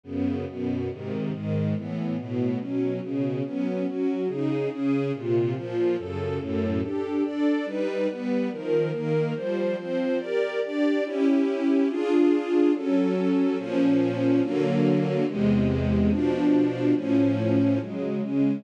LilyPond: \new Staff { \time 2/2 \key d \dorian \tempo 2 = 142 <fis, cis b>2 <fis, b, b>2 | <gis, bis, dis>2 <gis, dis gis>2 | <a, e b>2 <a, b, b>2 | <b, fis cis'>2 <b, cis cis'>2 |
<fis b cis'>2 <fis cis' fis'>2 | \key c \dorian <des ees' aes'>2 <des des' aes'>2 | <bes, c f'>2 <bes, f f'>2 | <fis, cis a'>2 <fis, a, a'>2 |
<d' g' a'>2 <d' a' d''>2 | <g dis' b'>2 <g b b'>2 | <ees f bes'>2 <ees bes bes'>2 | <f g c''>2 <f c' c''>2 |
<g' bes' d''>2 <d' g' d''>2 | \key f \dorian <des' fes' g'>1 | <d' f' aes'>1 | <ges des' a'>1 |
<bes, f des'>1 | <d fis ais>1 | <e, bis, gis>1 | <b, f d'>1 |
<a, eis cis'>1 | \key c \dorian <des ges aes>2 <des aes des'>2 | }